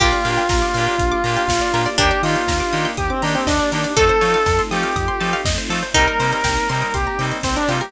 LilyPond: <<
  \new Staff \with { instrumentName = "Lead 1 (square)" } { \time 4/4 \key bes \major \tempo 4 = 121 f'1 | g'8 f'4. g'16 c'16 d'16 c'16 d'8 d'8 | a'4. g'4. r4 | bes'8. bes'8. bes'8 g'8. r16 c'16 d'16 f'16 g'16 | }
  \new Staff \with { instrumentName = "Pizzicato Strings" } { \time 4/4 \key bes \major g'1 | d'2 r2 | a'1 | ees'1 | }
  \new Staff \with { instrumentName = "Electric Piano 2" } { \time 4/4 \key bes \major <bes d' f' g'>8 <bes d' f' g'>4 <bes d' f' g'>4 <bes d' f' g'>4 <bes d' f' g'>8 | <bes d' ees' g'>8 <bes d' ees' g'>4 <bes d' ees' g'>4 <bes d' ees' g'>4 <bes d' ees' g'>8 | <a c' ees' f'>8 <a c' ees' f'>4 <a c' ees' f'>4 <a c' ees' f'>4 <a c' ees' f'>8 | <g bes c' ees'>8 <g bes c' ees'>4 <g bes c' ees'>4 <g bes c' ees'>4 <g bes c' ees'>8 | }
  \new Staff \with { instrumentName = "Pizzicato Strings" } { \time 4/4 \key bes \major bes'16 d''16 f''16 g''16 bes''16 d'''16 f'''16 g'''16 f'''16 d'''16 bes''16 g''16 f''16 d''16 bes'16 d''16 | bes'16 d''16 ees''16 g''16 bes''16 d'''16 ees'''16 g'''16 ees'''16 d'''16 bes''16 g''16 ees''16 d''16 bes'16 d''16 | a'16 c''16 des''16 f''16 a''16 c'''16 ees'''16 f'''16 ees'''16 c'''16 a''16 f''16 ees''16 c''16 a'16 c''16 | g'16 bes'16 c''16 ees''16 g''16 bes''16 c'''16 ees'''16 c'''16 bes''16 g''16 ees''16 c''16 bes'16 g'16 bes'16 | }
  \new Staff \with { instrumentName = "Synth Bass 1" } { \clef bass \time 4/4 \key bes \major bes,,8 bes,8 bes,,8 bes,8 bes,,8 bes,8 bes,,8 bes,8 | ees,8 ees8 ees,8 ees8 ees,8 ees8 ees,8 ees8 | f,8 f8 f,8 f8 f,8 f8 f,8 f8 | c,8 c8 c,8 c8 c,8 c8 c,8 c8 | }
  \new Staff \with { instrumentName = "String Ensemble 1" } { \time 4/4 \key bes \major <bes d' f' g'>1 | <bes d' ees' g'>1 | <a c' ees' f'>1 | <g bes c' ees'>1 | }
  \new DrumStaff \with { instrumentName = "Drums" } \drummode { \time 4/4 <cymc bd>8 hho8 <bd sn>8 hho8 <hh bd>8 hho8 <bd sn>8 hho8 | <hh bd>8 hho8 <bd sn>8 hho8 <hh bd>8 hho8 <bd sn>8 hho8 | <hh bd>8 hho8 <bd sn>8 hho8 <hh bd>8 hho8 <bd sn>8 hho8 | <hh bd>8 hho8 <bd sn>8 hho8 <hh bd>8 hho8 <bd sn>8 hho8 | }
>>